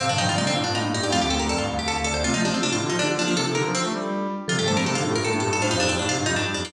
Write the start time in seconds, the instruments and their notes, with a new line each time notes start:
0.00 marimba A2 C3 F5, brass section C3, pizzicato strings C4
0.09 brass section G2, marimba A#2 D3, pizzicato strings D4
0.18 brass section G2, marimba D3 F3 G5, pizzicato strings D#4
0.28 brass section G2, marimba D#3 G3, pizzicato strings F4
0.35 brass section C3, marimba A3 C4 D5, pizzicato strings D#4
0.46 brass section D3, marimba A#3 D4, pizzicato strings C4
0.54 brass section A2, marimba D4 F4 F5
0.64 brass section G2, pizzicato strings D4
0.75 brass section A2, pizzicato strings D#4
0.84 brass section A2, marimba A#3 D4 F5
0.93 brass section G2, marimba D#4 G4 D5, pizzicato strings D#4
1.02 brass section G2, pizzicato strings G4
1.10 brass section F2, marimba A3 C4 F5, pizzicato strings F4
1.20 brass section D2, pizzicato strings G4
1.30 brass section D2, pizzicato strings A4, marimba G5
1.39 brass section D2, pizzicato strings A#4
1.49 brass section F2, pizzicato strings A4, marimba D5
1.58 brass section G2, pizzicato strings F4
1.69 brass section D2, marimba F5
1.79 brass section D2, pizzicato strings G4
1.88 brass section D2, pizzicato strings A4
1.96 brass section D2, marimba F5
2.04 brass section D2, pizzicato strings A4, marimba D5
2.14 brass section D2, pizzicato strings C5
2.24 brass section C3, marimba A3 C4 F4, pizzicato strings F4
2.34 brass section F3, marimba F3 A3, pizzicato strings D#4
2.43 brass section F3, marimba A3 C4 G4, pizzicato strings D4
2.53 brass section F3, marimba A3 C4, pizzicato strings C4
2.62 brass section C3, marimba D4 F4, pizzicato strings D4
2.71 brass section A2, marimba D4 F4, pizzicato strings F4
2.80 brass section D3, marimba D#4 F4 G4
2.90 brass section F3, pizzicato strings D#4, marimba D#4 G4
2.99 brass section D3, pizzicato strings D4, marimba D4 F4
3.09 brass section D3, marimba D4 F4 G4
3.18 brass section F3, marimba A#3 D4 F4, pizzicato strings D4
3.27 brass section F3, marimba A#3 D4, pizzicato strings A#3
3.36 brass section C3, marimba D4 F4 A4, pizzicato strings A4
3.45 brass section C3, marimba D#4 G4
3.55 brass section D3, marimba D#4 G4, pizzicato strings A#4
3.65 brass section F3, marimba D4 F4
3.75 brass section F3, pizzicato strings C4
3.84 brass section A3
3.93 brass section G3
4.48 brass section C3, marimba D3 F3 A4, pizzicato strings F4
4.58 brass section G2, marimba D#3 G3, pizzicato strings G4
4.67 brass section G2, marimba F3 A3 C5, pizzicato strings A4
4.77 brass section G2, marimba A3 C4, pizzicato strings A#4
4.85 brass section C3, marimba D#4 G4, pizzicato strings A4
4.95 brass section D3, marimba D#4 G4, pizzicato strings F4
5.03 brass section A2, marimba D4 F4 A4
5.14 brass section G2, pizzicato strings A#4
5.23 brass section A2, pizzicato strings A4
5.32 brass section A2, marimba A#3 D4 A4
5.40 brass section G2, marimba D#4 G4, pizzicato strings A4
5.53 brass section G2, pizzicato strings A4
5.61 brass section A2, marimba D4 F4 C5, pizzicato strings F4
5.70 brass section F2, marimba D#4 G4, pizzicato strings D#4
5.77 brass section F2, pizzicato strings D4, marimba D#4 G4 F5
5.89 brass section F2, pizzicato strings C4, marimba D#4 G4
5.98 brass section A2, pizzicato strings D4, marimba D#4 G4
6.07 brass section C3, marimba D#4 G4, pizzicato strings F4
6.16 brass section G2, marimba D4 F4
6.26 brass section F2, pizzicato strings D#4
6.36 brass section G2, pizzicato strings D4
6.45 brass section G2, marimba D#4 G4
6.54 brass section F2, pizzicato strings D4, marimba D#4 G4
6.65 brass section F2, pizzicato strings A#3